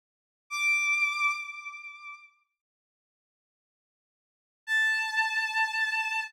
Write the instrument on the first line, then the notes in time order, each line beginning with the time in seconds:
violin
0.50 D6
4.67 A5